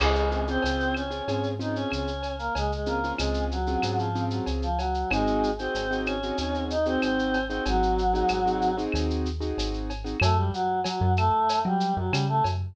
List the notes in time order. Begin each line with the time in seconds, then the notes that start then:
0.00 C#2 G#3 C4 C#4 F4 G#4, crash, cowbell, claves
0.15 shaker
0.31 C4 C#4 F4 G#4, shaker
0.47 C4 C#4 F4 G#4 C5, shaker
0.62 C#2 C4 C#4 F4 G#4, cowbell, shaker
0.80 shaker
0.95 C#4 C#5, claves, shaker
1.10 C4 C#4 F4 G#4, shaker
1.28 G#2 C4 C#4 F4 G#4, cowbell, shaker
1.43 shaker
1.59 C4 C#4 D#4 F4 G#4 D#5, shaker
1.75 C#4 C#5, shaker
1.90 C#2 C#4 C#5, cowbell, claves, shaker
2.07 shaker
2.23 cowbell, shaker
2.39 A#3 A#4, shaker
2.55 C#2 G#3 G#4, cowbell, shaker
2.72 G#3 G#4, shaker
2.86 A#3 C4 C#4 F4 G#4 A#4, shaker
3.04 C4 C#4 F4 G#4, shaker
3.17 C#2 G#3 C4 C#4 F4 G#4, cowbell, claves, shaker
3.34 shaker
3.51 F#3 F#4, shaker
3.67 C4 C#4 F4 G#4, shaker
3.82 G#2 C4 C#4 F4 G#4, cowbell, claves, shaker
3.97 F3 F4, shaker
4.15 C4 C#4 F4 G#4, shaker
4.30 F#3 F#4, shaker
4.46 C#2, cowbell, shaker
4.62 F3 F4, shaker
4.78 F#3 F#4, cowbell, shaker
4.94 shaker
5.11 G#1 G#3 C4 D#4 F#4 G#4, cowbell, claves, shaker
5.27 shaker
5.43 shaker
5.59 C4 D#4 F#4 G#4 C5, shaker
5.74 G#1, cowbell, shaker
5.91 C4 D#4 F#4 G#4, shaker
6.05 C#4 C#5, claves, shaker
6.23 C4 D#4 F#4 G#4, shaker
6.38 D#2, cowbell, shaker
6.54 shaker
6.70 D#4 D#5, shaker
6.86 C4 D#4 F#4 G#4 C5, shaker
7.01 G#1 C4 C5, cowbell, claves, shaker
7.19 shaker
7.34 cowbell, shaker
7.49 C4 D#4 F#4 G#4 C5, shaker
7.65 G#1 F#3 F#4, cowbell, shaker
7.83 shaker
7.98 shaker
8.14 C4 D#4 F#4 G#4, shaker
8.28 G#1, cowbell, claves, shaker
8.45 C4 D#4 F#4 G#4, shaker
8.61 shaker
8.77 C4 D#4 F#4 G#4, shaker
8.92 D#2, cowbell, claves, shaker
9.10 shaker
9.26 shaker
9.40 C4 D#4 F#4 G#4, shaker
9.57 G#1, cowbell, shaker
9.74 shaker
9.90 cowbell, shaker
10.04 C4 D#4 F#4 G#4, shaker
10.20 F#2 A3 A4, cowbell, claves, shaker
10.36 G3 G4
10.53 F#3 F#4, shaker
10.84 F#3 F#4, cowbell, shaker
11.01 F#2
11.17 A3 A4, claves, shaker
11.49 cowbell, shaker
11.65 F#3 G3 G4
11.80 shaker
11.97 F#2 F#3 F#4
12.11 C#3 G3 G4, cowbell, claves, shaker
12.28 A3 A4
12.44 F#2, cowbell, shaker